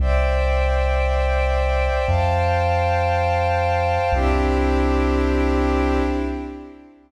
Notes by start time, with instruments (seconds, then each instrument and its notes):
0.00 synth bass 2 C2, pad 2 (warm) C5 D5 E5 G5
2.06 synth bass 2 F2, pad 2 (warm) C5 F5 G5 A5
4.12 synth bass 2 C2, pad 2 (warm) C4 D4 E4 G4